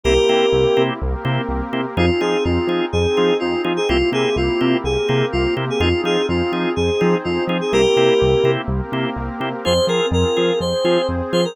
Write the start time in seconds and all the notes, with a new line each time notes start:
0.04 C2 A#3 C4 E4 G4 A#4
0.29 C3 A#3 C4 E4 G4
0.53 C2
0.77 C3 A#3 C4 E4 G4
1.00 C2 A#3 C4 G4 A#4
1.25 C3 A#3 C4 E4 G4
1.49 C2
1.73 C3 A#3 C4 E4 G4
1.97 F2 C4 D#4 F4 G#4
2.21 F3 C4 D#4 F4 G#4
2.44 F2 F4
2.67 F3 C4 D#4 F4 G#4
2.92 F2 C4 D#4 G#4 C5
3.17 F3 C4 D#4 F4 G#4
3.40 F2 F4
3.64 F3 C4 D#4 F4 G#4
3.77 G#4
3.89 C2 A#3 C4 E4 F4 G4
4.12 C3 A#3 C4 E4 G4 G#4
4.36 C2 F4
4.61 C3 A#3 C4 E4 G4
4.84 C2 A#3 C4 G4 G#4 A#4
5.08 C3 A#3 C4 E4 G4
5.32 C2 F4
5.57 C3 A#3 C4 E4 G4
5.70 G#4
5.79 F2 C4 D#4 F4 G#4
6.04 F3 C4 D#4 F4 G#4
6.29 F2 F4
6.52 F3 C4 D#4 F4 G#4
6.76 F2 C4 D#4 G#4 C5
7.01 F3 C4 D#4 F4 G#4
7.24 F2 F4
7.47 F3 C4 D#4 F4 G#4
7.61 G#4
7.72 C2 A#3 C4 E4 G4 A#4
7.96 C3 A#3 C4 E4 G4
8.22 C2
8.44 C3 A#3 C4 E4 G4
8.68 C2 A#3 C4 G4 A#4
8.92 C3 A#3 C4 E4 G4
9.16 C2
9.40 C3 A#3 C4 E4 G4
9.65 F2 C4 F4 G#4 C5
9.87 F3 C4 F4 G#4 A#4
10.11 F2 A#4
10.37 F3 C4 F4 G#4
10.60 F2 C4 G#4 C5
10.84 F3 C4 F4 G#4
11.09 F2
11.33 F3 C4 F4 G#4 C5
11.45 A#4